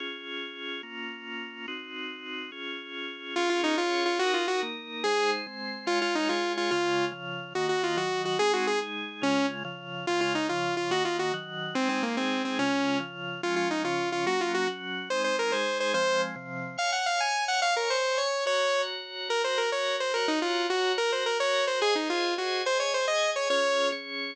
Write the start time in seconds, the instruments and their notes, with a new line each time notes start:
0.00 drawbar organ C#4 F4 G#4
0.83 drawbar organ A#3 C#4 F4
1.68 drawbar organ C4 D#4 F#4
2.52 drawbar organ C#4 F4 G#4
3.36 drawbar organ C#4 F4 G#4, lead 2 (sawtooth) F4
3.50 lead 2 (sawtooth) F4
3.64 lead 2 (sawtooth) D#4
3.78 drawbar organ C#4 G#4 C#5, lead 2 (sawtooth) F4
4.06 lead 2 (sawtooth) F4
4.19 drawbar organ D#4 F#4 A#4, lead 2 (sawtooth) F#4
4.34 lead 2 (sawtooth) F4
4.48 lead 2 (sawtooth) F#4
4.63 drawbar organ A#3 D#4 A#4
5.04 drawbar organ G#3 D#4 C5, lead 2 (sawtooth) G#4
5.47 drawbar organ G#3 C4 C5
5.86 drawbar organ G#3 F4 C#5, lead 2 (sawtooth) F4
6.02 lead 2 (sawtooth) F4
6.15 lead 2 (sawtooth) D#4
6.29 drawbar organ G#3 G#4 C#5, lead 2 (sawtooth) F4
6.57 lead 2 (sawtooth) F4
6.71 drawbar organ C#3 G#3 F4, lead 2 (sawtooth) F4
7.12 drawbar organ C#3 F3 F4
7.55 drawbar organ D#3 A#3 F#4, lead 2 (sawtooth) F#4
7.69 lead 2 (sawtooth) F#4
7.83 lead 2 (sawtooth) F4
7.97 drawbar organ D#3 F#3 F#4, lead 2 (sawtooth) F#4
8.25 lead 2 (sawtooth) F#4
8.39 drawbar organ G#3 C4 D#4, lead 2 (sawtooth) G#4
8.53 lead 2 (sawtooth) F#4
8.67 lead 2 (sawtooth) G#4
8.82 drawbar organ G#3 D#4 G#4
9.22 drawbar organ C#3 G#3 F4, lead 2 (sawtooth) C#4
9.64 drawbar organ C#3 F3 F4
10.07 drawbar organ C#3 G#3 F4, lead 2 (sawtooth) F4
10.21 lead 2 (sawtooth) F4
10.35 lead 2 (sawtooth) D#4
10.49 drawbar organ C#3 F3 F4, lead 2 (sawtooth) F4
10.77 lead 2 (sawtooth) F4
10.91 drawbar organ D#3 A#3 F#4, lead 2 (sawtooth) F#4
11.05 lead 2 (sawtooth) F4
11.19 lead 2 (sawtooth) F#4
11.34 drawbar organ D#3 F#3 F#4
11.75 drawbar organ G#3 C4 D#4, lead 2 (sawtooth) C4
11.89 lead 2 (sawtooth) C4
12.03 lead 2 (sawtooth) A#3
12.17 drawbar organ G#3 D#4 G#4, lead 2 (sawtooth) C4
12.45 lead 2 (sawtooth) C4
12.59 drawbar organ C#3 G#3 F4, lead 2 (sawtooth) C#4
13.00 drawbar organ C#3 F3 F4
13.43 drawbar organ F3 G#3 C#4, lead 2 (sawtooth) F4
13.56 lead 2 (sawtooth) F4
13.71 lead 2 (sawtooth) D#4
13.84 drawbar organ C#3 F3 C#4, lead 2 (sawtooth) F4
14.12 lead 2 (sawtooth) F4
14.26 drawbar organ F#3 A#3 C#4, lead 2 (sawtooth) F#4
14.41 lead 2 (sawtooth) F4
14.54 lead 2 (sawtooth) F#4
14.67 drawbar organ F#3 C#4 F#4
15.10 drawbar organ G#3 C4 D#4, lead 2 (sawtooth) C5
15.24 lead 2 (sawtooth) C5
15.39 lead 2 (sawtooth) A#4
15.52 drawbar organ G#3 D#4 G#4, lead 2 (sawtooth) C5
15.80 lead 2 (sawtooth) C5
15.94 drawbar organ F3 G#3 C4, lead 2 (sawtooth) C5
16.36 drawbar organ C3 F3 C4
16.78 drawbar organ C#5 F5 G#5, lead 2 (sawtooth) F5
16.92 lead 2 (sawtooth) F#5
17.06 lead 2 (sawtooth) F5
17.20 lead 2 (sawtooth) G#5
17.48 lead 2 (sawtooth) F#5
17.62 drawbar organ C#5 G#5 C#6, lead 2 (sawtooth) F5
17.76 lead 2 (sawtooth) A#4
17.90 lead 2 (sawtooth) C5
18.18 lead 2 (sawtooth) C#5
18.46 drawbar organ F#4 C#5 A#5, lead 2 (sawtooth) C#5
19.29 drawbar organ F#4 A#4 A#5, lead 2 (sawtooth) A#4
19.44 lead 2 (sawtooth) C5
19.58 lead 2 (sawtooth) A#4
19.72 lead 2 (sawtooth) C#5
20.00 lead 2 (sawtooth) C5
20.14 drawbar organ F#4 C#5 A#5, lead 2 (sawtooth) A#4
20.28 lead 2 (sawtooth) D#4
20.42 lead 2 (sawtooth) F4
20.70 lead 2 (sawtooth) F#4
20.98 drawbar organ F#4 A#4 A#5, lead 2 (sawtooth) A#4
21.12 lead 2 (sawtooth) C5
21.26 lead 2 (sawtooth) A#4
21.40 lead 2 (sawtooth) C#5
21.67 lead 2 (sawtooth) C5
21.81 drawbar organ G#4 C5 D#5, lead 2 (sawtooth) G#4
21.95 lead 2 (sawtooth) D#4
22.10 lead 2 (sawtooth) F4
22.38 lead 2 (sawtooth) F#4
22.65 drawbar organ G#4 D#5 G#5, lead 2 (sawtooth) C5
22.80 lead 2 (sawtooth) C#5
22.94 lead 2 (sawtooth) C5
23.08 lead 2 (sawtooth) D#5
23.36 lead 2 (sawtooth) C#5
23.50 drawbar organ C#4 F4 G#4, lead 2 (sawtooth) C#5
23.92 drawbar organ C#4 G#4 C#5